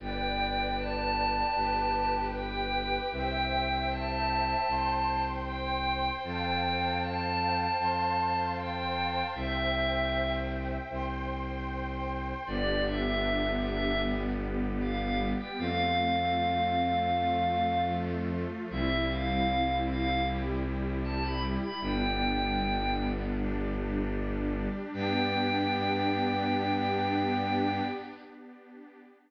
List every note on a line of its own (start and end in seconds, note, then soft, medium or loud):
0.00 1.43 G1 medium
0.00 1.54 B4 medium
0.00 1.54 D5 medium
0.00 0.72 G5 medium
0.00 1.54 G5 medium
0.78 2.17 A5 medium
1.55 2.99 G1 medium
1.55 3.09 G4 medium
1.55 3.09 B4 medium
1.55 3.09 G5 medium
2.34 3.03 G5 medium
3.11 4.55 C2 medium
3.11 4.66 C5 medium
3.11 4.66 E5 medium
3.11 3.85 G5 medium
3.11 4.66 G5 medium
3.90 5.20 A5 medium
4.67 6.11 C2 medium
4.67 6.22 C5 medium
4.67 6.22 G5 medium
4.67 6.22 C6 medium
5.46 6.10 G5 medium
6.23 7.67 F2 medium
6.23 7.77 C5 medium
6.23 7.77 F5 medium
6.23 6.96 G5 medium
6.23 7.77 G5 medium
6.23 7.77 A5 medium
7.01 8.45 A5 medium
7.79 9.23 F2 medium
7.79 9.33 C5 medium
7.79 9.33 F5 medium
7.79 9.33 A5 medium
7.79 9.33 C6 medium
8.57 9.24 G5 medium
9.35 10.78 C2 loud
9.35 10.90 C5 medium
9.35 10.31 E5 medium
9.35 10.90 E5 medium
9.35 10.90 G5 medium
10.90 12.34 C2 medium
10.90 12.45 C5 medium
10.90 12.45 G5 medium
10.90 12.45 C6 medium
12.46 15.34 G1 loud
12.46 14.01 B3 medium
12.46 14.01 D4 medium
12.46 14.01 G4 medium
12.46 12.82 D5 medium
12.85 13.53 E5 medium
13.63 14.01 E5 medium
14.03 15.57 G3 medium
14.03 15.57 B3 medium
14.03 15.57 G4 medium
14.80 14.99 F5 medium
15.00 15.19 F5 medium
15.39 15.57 G5 medium
15.58 18.45 F2 loud
15.58 17.12 A3 medium
15.58 17.12 C4 medium
15.58 17.12 F4 medium
15.58 17.84 F5 medium
17.14 18.68 F3 medium
17.14 18.68 A3 loud
17.14 18.68 F4 medium
18.69 21.57 C2 loud
18.69 20.24 G3 medium
18.69 20.24 C4 medium
18.69 20.24 E4 medium
18.69 19.04 E5 medium
19.09 19.75 F5 medium
19.87 20.21 F5 medium
20.27 21.81 G3 medium
20.27 21.81 E4 medium
20.27 21.81 G4 medium
21.04 21.22 A5 medium
21.23 21.42 B5 medium
21.62 21.81 B5 medium
21.81 24.68 G1 loud
21.81 23.36 G3 medium
21.81 23.36 B3 medium
21.81 23.36 D4 medium
21.81 22.95 G5 medium
23.38 24.92 G3 medium
23.38 24.92 D4 medium
23.38 24.92 G4 medium
24.94 27.81 G2 loud
24.94 27.82 B3 loud
24.94 27.82 D4 loud
24.94 27.82 G4 loud
24.94 27.81 G5 loud